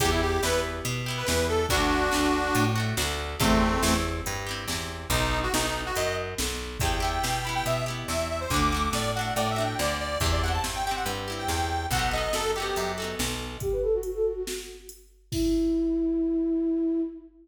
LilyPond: <<
  \new Staff \with { instrumentName = "Accordion" } { \time 4/4 \key e \minor \tempo 4 = 141 g'16 e'16 g'8 b'8 r4 r16 b'16 b'8 a'8 | <d' fis'>2~ <d' fis'>8 r4. | <a c'>4. r2 r8 | dis'8. fis'16 dis'16 dis'8 fis'16 dis''8 r4. |
g''8 g''4 b''16 g''16 e''8 r8 e''8 e''16 c''16 | d'''8. d'''16 d''8 fis''8 \tuplet 3/2 { d''8 e''8 g''8 } d''8 d''8 | r16 d''16 fis''16 a''16 r16 g''16 g''16 fis''16 r8. g''16 g''4 | fis''8 dis''8 a'8 g'4 r4. |
r1 | r1 | }
  \new Staff \with { instrumentName = "Flute" } { \time 4/4 \key e \minor r1 | r1 | r1 | r1 |
r1 | r1 | r1 | r1 |
g'16 b'16 a'16 fis'16 fis'16 a'16 fis'16 fis'16 r2 | e'1 | }
  \new Staff \with { instrumentName = "Acoustic Guitar (steel)" } { \time 4/4 \key e \minor <b e' g'>4 <b e' g'>4. <b e' g'>8 <b e' g'>4 | <a d' fis'>4 <a d' fis'>4. <a d' fis'>8 <a d' fis'>4 | <c' e' g'>4 <c' e' g'>4. <c' e' g'>8 <c' e' g'>4 | r1 |
<b e' g'>8 <b e' g'>4 <b e' g'>4 <b e' g'>4. | <a d' fis'>8 <a d' fis'>4 <a d' fis'>4 <a d' fis'>4. | <c' e' g'>8 <c' e' g'>4 <c' e' g'>4 <c' e' g'>4. | <b dis' fis' a'>8 <b dis' fis' a'>4 <b dis' fis' a'>4 <b dis' fis' a'>4. |
r1 | r1 | }
  \new Staff \with { instrumentName = "Electric Bass (finger)" } { \clef bass \time 4/4 \key e \minor e,4 e,4 b,4 e,4 | d,4 d,4 a,4 d,4 | e,4 e,4 g,4 e,4 | b,,4 b,,4 fis,4 b,,4 |
e,4 b,4 b,4 e,4 | d,4 a,4 a,4 d,4 | e,4 g,4 g,4 e,4 | b,,4 fis,4 fis,4 b,,4 |
r1 | r1 | }
  \new DrumStaff \with { instrumentName = "Drums" } \drummode { \time 4/4 <hh bd>4 sn4 hh4 sn4 | <hh bd>4 sn4 hh4 sn4 | <hh bd>4 sn4 hh4 sn4 | <hh bd>4 sn4 hh4 sn4 |
<hh bd>4 sn4 hh4 sn4 | <hh bd>4 sn4 hh4 sn4 | <hh bd>4 sn4 hh4 sn4 | <hh bd>4 sn4 hh4 sn4 |
<hh bd>4 hh4 sn4 hh4 | <cymc bd>4 r4 r4 r4 | }
>>